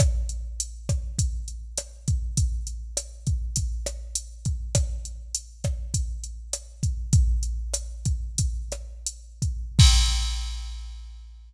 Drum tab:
CC |--------|--------|--------|--------|
HH |xxxxxxxx|xxxxxxxx|xxxxxxxx|xxxxxxxx|
SD |r--r--r-|--r--r--|r--r--r-|--r--r--|
BD |o--oo--o|o--oo--o|o--oo--o|o--oo--o|

CC |x-------|
HH |--------|
SD |--------|
BD |o-------|